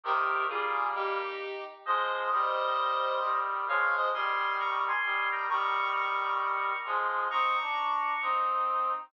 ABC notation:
X:1
M:4/4
L:1/8
Q:"Swing" 1/4=132
K:Ab
V:1 name="Lead 1 (square)"
[GB]2 [FA]2 [EG]3 z | [ce]8 | [df] [ce] [ac']2 [bd'] [ac']2 [gb] | [bd']2 [bd']4 z2 |
[bd']5 z3 |]
V:2 name="Brass Section"
[C,E,]2 [G,B,]3 z3 | [F,A,]2 [E,G,]4 [E,G,]2 | [F,A,]2 [E,G,]4 [E,G,]2 | [E,G,]6 [F,A,]2 |
[CE] =D3 [CE]3 z |]